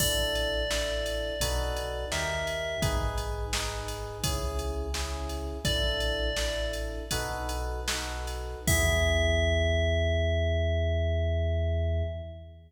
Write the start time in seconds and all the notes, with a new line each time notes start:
0.00 A1 D4 E4 A4 D5, kick, crash
0.35 ride
0.71 D4 E4 A4, snare
1.06 ride
1.40 B1 D#4 F#4 A4 B4, kick, ride
1.76 ride
2.11 D#2 D#4 G4 A#4 E5, snare
2.47 ride
2.82 G#1 D#4 G#4 B4, kick, ride
3.18 ride
3.53 D#4 G#4 B4, snare
3.88 ride
4.24 C#2 C#4 E4 G#4, kick, ride
4.59 ride
4.94 C#4 E4 G#4, snare
5.29 ride
5.65 A1 D4 E4 A4 D5, kick, ride
6.00 ride
6.36 D4 E4 A4, snare
6.73 ride
7.11 B1 D#4 F#4 A4 B4, kick, ride
7.49 ride
7.88 D#4 F#4 A4 B4, snare
8.27 ride
8.67 E2 B3 E4 G#4 E5, kick, crash